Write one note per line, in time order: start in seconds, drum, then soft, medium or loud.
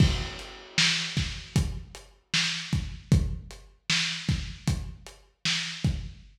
0.00 kick loud
0.00 crash loud
0.39 closed hi-hat medium
0.78 snare loud
1.17 kick medium
1.17 snare medium
1.17 closed hi-hat medium
1.56 kick loud
1.56 closed hi-hat loud
1.95 closed hi-hat medium
2.34 snare loud
2.73 kick loud
2.73 closed hi-hat medium
3.12 kick loud
3.12 closed hi-hat loud
3.51 closed hi-hat medium
3.90 snare loud
4.29 kick loud
4.29 snare medium
4.29 closed hi-hat medium
4.68 kick loud
4.68 closed hi-hat loud
5.06 closed hi-hat medium
5.45 snare loud
5.84 kick loud
5.84 closed hi-hat medium